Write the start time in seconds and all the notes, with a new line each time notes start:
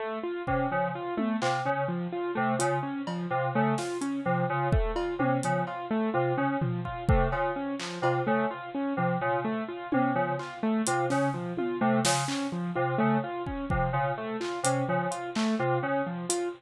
0.00 A3
0.23 F4
0.47 C3 C#4, kick
0.71 C#3 F3
0.95 F4
1.17 A3, high tom
1.42 C3 F4, clap
1.65 C#3 C#4
1.88 F3
2.12 F4
2.35 C3 A3
2.59 C#3 F4, closed hi-hat
2.83 C#4
3.07 F3, cowbell
3.30 C3 F4
3.55 C#3 A3
3.78 F4, snare
4.01 C#4, closed hi-hat
4.25 C3 F3
4.50 C#3 F4
4.72 A3, kick
4.96 F4, cowbell
5.19 C3 C#4, high tom
5.43 C#3 F3, closed hi-hat
5.67 F4, cowbell
5.91 A3
6.14 C3 F4
6.37 C#3 C#4
6.61 F3, floor tom
6.85 F4, kick
7.09 C3 A3, kick
7.32 C#3 F4, cowbell
7.56 C#4
7.79 F3, clap
8.02 C3 F4, cowbell
8.27 C#3 A3
8.51 F4
8.75 C#4
8.97 C3 F3
9.21 C#3 F4, floor tom
9.44 A3
9.68 F4
9.92 C3 C#4, high tom
10.15 C#3 F3
10.39 F4, clap
10.63 A3
10.87 C3 F4, closed hi-hat
11.10 C#3 C#4, snare
11.34 F3, floor tom
11.57 F4, high tom
11.81 C3 A3
12.05 C#3 F4, snare
12.28 C#4, clap
12.52 F3
12.75 C3 F4
12.98 C#3 A3
13.24 F4
13.46 C#4, kick
13.70 C3 F3, kick
13.93 C#3 F4, floor tom
14.18 A3
14.41 F4, clap
14.63 C3 C#4, closed hi-hat
14.88 C#3 F3
15.11 F4, closed hi-hat
15.35 A3, clap
15.59 C3 F4
15.83 C#3 C#4
16.06 F3
16.29 F4, closed hi-hat